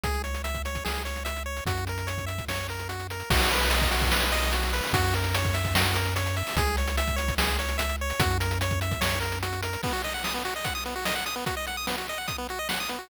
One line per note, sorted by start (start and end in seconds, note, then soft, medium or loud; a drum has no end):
0.03 0.79 C#2 loud
0.03 0.22 G#4 medium
0.03 kick medium
0.03 closed hi-hat medium
0.14 closed hi-hat medium
0.24 0.42 C#5 medium
0.24 closed hi-hat medium
0.34 closed hi-hat medium
0.44 0.62 E5 medium
0.44 closed hi-hat medium
0.54 kick medium
0.54 closed hi-hat medium
0.65 0.84 C#5 medium
0.65 closed hi-hat medium
0.75 kick medium
0.75 closed hi-hat medium
0.85 1.61 C#2 medium
0.85 1.03 G#4 medium
0.85 snare loud
0.95 closed hi-hat medium
1.05 1.23 C#5 medium
1.05 closed hi-hat medium
1.16 closed hi-hat medium
1.25 1.43 E5 medium
1.25 closed hi-hat medium
1.36 closed hi-hat medium
1.46 1.64 C#5 medium
1.57 closed hi-hat medium
1.66 2.41 F#2 loud
1.66 1.85 F#4 medium
1.66 kick medium
1.66 closed hi-hat loud
1.77 closed hi-hat medium
1.87 2.07 A#4 medium
1.87 closed hi-hat medium
1.98 closed hi-hat medium
2.07 2.25 C#5 medium
2.07 closed hi-hat medium
2.18 kick medium
2.18 closed hi-hat medium
2.26 2.45 E5 medium
2.26 closed hi-hat medium
2.38 kick medium
2.38 closed hi-hat medium
2.48 3.23 F#2 medium
2.48 2.67 C#5 medium
2.48 snare medium
2.69 2.88 A#4 medium
2.69 closed hi-hat medium
2.79 closed hi-hat medium
2.89 3.07 F#4 medium
2.89 closed hi-hat medium
2.99 closed hi-hat medium
3.10 3.30 A#4 medium
3.10 closed hi-hat medium
3.20 closed hi-hat medium
3.30 4.81 B1 loud
3.30 3.51 F#4 loud
3.30 kick loud
3.30 crash loud
3.40 closed hi-hat medium
3.51 3.72 B4 medium
3.51 closed hi-hat medium
3.61 closed hi-hat medium
3.70 3.90 D#5 medium
3.70 closed hi-hat loud
3.81 kick loud
3.81 closed hi-hat medium
3.91 4.11 F#4 medium
3.91 closed hi-hat loud
4.01 kick medium
4.01 closed hi-hat medium
4.11 4.32 B4 medium
4.11 snare loud
4.22 closed hi-hat medium
4.32 4.52 D#5 medium
4.32 closed hi-hat loud
4.42 closed hi-hat medium
4.52 4.72 F#4 medium
4.52 closed hi-hat loud
4.63 closed hi-hat medium
4.73 4.93 B4 medium
4.73 closed hi-hat medium
4.83 open hi-hat medium
4.93 6.43 F#2 loud
4.93 5.14 F#4 loud
4.93 kick loud
4.93 closed hi-hat loud
5.04 closed hi-hat medium
5.14 5.35 A#4 medium
5.14 closed hi-hat medium
5.24 closed hi-hat medium
5.35 5.55 C#5 medium
5.35 closed hi-hat loud
5.44 kick loud
5.44 closed hi-hat medium
5.54 5.74 E5 medium
5.54 closed hi-hat medium
5.65 kick medium
5.65 closed hi-hat medium
5.75 5.97 F#4 medium
5.75 snare loud
5.86 closed hi-hat medium
5.94 6.14 A#4 medium
5.94 closed hi-hat loud
6.06 closed hi-hat medium
6.16 6.36 C#5 medium
6.16 closed hi-hat loud
6.26 closed hi-hat medium
6.36 6.56 E5 medium
6.36 closed hi-hat medium
6.47 open hi-hat medium
6.56 7.31 C#2 loud
6.56 6.76 G#4 loud
6.56 kick loud
6.56 closed hi-hat loud
6.67 closed hi-hat medium
6.77 6.96 C#5 medium
6.77 closed hi-hat medium
6.87 closed hi-hat medium
6.97 7.16 E5 medium
6.97 closed hi-hat loud
7.07 kick medium
7.07 closed hi-hat medium
7.16 7.35 C#5 medium
7.16 closed hi-hat medium
7.28 kick medium
7.28 closed hi-hat medium
7.38 8.13 C#2 loud
7.38 7.57 G#4 medium
7.38 snare loud
7.48 closed hi-hat medium
7.59 7.77 C#5 medium
7.59 closed hi-hat medium
7.69 closed hi-hat medium
7.78 7.96 E5 medium
7.78 closed hi-hat loud
7.89 closed hi-hat medium
8.01 8.20 C#5 medium
8.10 closed hi-hat medium
8.19 8.95 F#2 loud
8.19 8.38 F#4 loud
8.19 kick loud
8.19 closed hi-hat loud
8.30 closed hi-hat medium
8.40 8.59 A#4 medium
8.40 closed hi-hat loud
8.51 closed hi-hat medium
8.61 8.80 C#5 medium
8.61 closed hi-hat loud
8.71 kick medium
8.71 closed hi-hat medium
8.81 9.00 E5 medium
8.81 closed hi-hat medium
8.91 kick medium
8.91 closed hi-hat medium
9.01 9.77 F#2 medium
9.01 9.19 C#5 medium
9.01 snare loud
9.20 9.39 A#4 medium
9.20 closed hi-hat medium
9.32 closed hi-hat medium
9.43 9.61 F#4 medium
9.43 closed hi-hat loud
9.53 closed hi-hat medium
9.62 9.82 A#4 medium
9.62 closed hi-hat loud
9.73 closed hi-hat medium
9.83 9.93 B3 loud
9.83 kick loud
9.83 crash medium
9.93 10.02 F#4 medium
10.04 10.13 D#5 medium
10.04 closed hi-hat medium
10.14 10.23 F#5 medium
10.24 10.34 D#6 medium
10.24 snare loud
10.34 10.43 B3 medium
10.45 10.54 F#4 medium
10.45 closed hi-hat medium
10.56 10.65 D#5 medium
10.64 10.74 F#5 medium
10.64 kick medium
10.64 closed hi-hat loud
10.75 10.84 D#6 medium
10.85 10.95 B3 medium
10.85 closed hi-hat medium
10.96 11.05 F#4 medium
11.05 11.15 D#5 loud
11.05 snare loud
11.15 11.25 F#5 medium
11.26 11.35 D#6 medium
11.26 closed hi-hat medium
11.36 11.45 B3 medium
11.46 11.55 F#4 medium
11.46 kick medium
11.46 closed hi-hat loud
11.57 11.66 D#5 medium
11.67 11.77 F#5 medium
11.67 closed hi-hat medium
11.77 11.86 D#6 medium
11.87 11.96 B3 medium
11.87 snare loud
11.98 12.07 F#4 medium
12.08 12.18 D#5 medium
12.08 closed hi-hat medium
12.18 12.27 F#5 medium
12.27 12.37 D#6 medium
12.27 kick medium
12.27 closed hi-hat medium
12.38 12.47 B3 medium
12.49 12.59 F#4 medium
12.49 closed hi-hat medium
12.59 12.68 D#5 medium
12.69 12.79 F#5 medium
12.69 snare loud
12.80 12.89 D#6 medium
12.89 12.98 B3 medium
12.89 closed hi-hat medium
12.99 13.08 F#4 medium